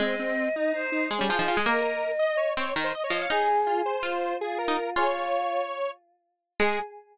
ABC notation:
X:1
M:9/8
L:1/16
Q:3/8=109
K:Ab
V:1 name="Choir Aahs"
e8 c4 A6 | e10 z2 e2 z e d2 | A8 F4 F6 | A F7 z10 |
A6 z12 |]
V:2 name="Lead 1 (square)"
C2 C4 E2 E2 E2 z D F E F A | B2 B4 e2 d2 d2 z c e d e f | A2 z2 F2 c6 A2 B4 | d12 z6 |
A6 z12 |]
V:3 name="Pizzicato Strings"
A,12 A, G, F, F, F, A, | B,10 C2 E,2 z2 F,2 | E8 F4 z3 E z2 | F10 z8 |
A,6 z12 |]